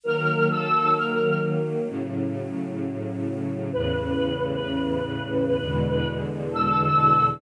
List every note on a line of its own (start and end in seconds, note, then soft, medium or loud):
0.03 1.87 D#3 medium
0.03 1.87 F#3 loud
0.03 1.87 A#3 medium
0.03 0.46 A#4 loud
0.50 0.89 A4 loud
0.96 1.38 A#4 medium
1.88 3.70 A2 loud
1.88 3.70 C#3 medium
1.88 3.70 F#3 medium
3.73 5.56 E2 medium
3.73 5.56 A2 medium
3.73 5.56 C#3 loud
3.73 6.08 B4 loud
5.59 7.41 E2 loud
5.59 7.41 B2 medium
5.59 7.41 D3 medium
5.59 7.41 G#3 medium
6.50 7.24 A4 loud